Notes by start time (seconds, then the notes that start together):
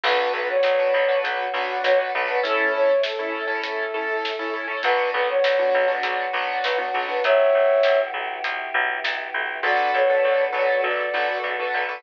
0.04 B1 B3 D4 F#4 B4, kick, crash
0.33 B1 B4
0.49 C#5
0.63 B1, snare
0.79 D4 F#4 B4
0.94 B1
1.08 D4 F#4 B4
1.24 B1 F#3 B3 F#4, closed hi-hat
1.54 B1 D4 F#4 B4
1.84 B1 C#5, snare
1.99 D4 F#4 B4
2.15 B1 D4 F#4 B4
2.28 D4 F#4 B4
2.43 A3 C#4 E4 A4, kick, closed hi-hat
2.74 C#5
3.03 A4, snare
3.19 C#4 E4 A4
3.48 C#4 E4 A4
3.63 A3 E4 A4, closed hi-hat
3.94 C#4 E4 A4
4.25 snare
4.39 C#4 E4 A4
4.53 C#4 E4 A4
4.67 C#4 E4 A4
4.83 B1 B3 D4 F#4 B4, kick, closed hi-hat
5.14 B1 B4
5.29 C#5
5.44 B1, snare
5.59 B3 D4 F#4
5.74 B1
5.88 B3 D4 F#4
6.03 B1 F#3 B3 F#4, closed hi-hat
6.33 B1 B3 D4 F#4
6.64 B1 B4, snare
6.78 B3 D4 F#4
6.94 B1 B3 D4 F#4
7.08 B3 D4 F#4 B4
7.24 B1 B3 E4 F#4 G4 C#5 E5, kick, closed hi-hat
7.55 B1
7.83 B1, snare
8.14 B1
8.44 B1 B3 E4 G4 B4, closed hi-hat
8.74 B1
9.04 B1, snare
9.34 B1
9.63 B1 B3 D4 F#4 A4 B4 D5
9.94 B1 C#5
10.10 D4 F#4 A4 B4
10.24 B1
10.53 B1 D4 F#4 A4 B4 C#5
10.82 B1 B3 D4 A4 B4 D5
11.13 B1 D4 F#4 A4 B4
11.28 D4 F#4 A4 B4
11.44 B1
11.59 D4 F#4 A4 B4
11.74 B1
11.88 D4 F#4 A4 B4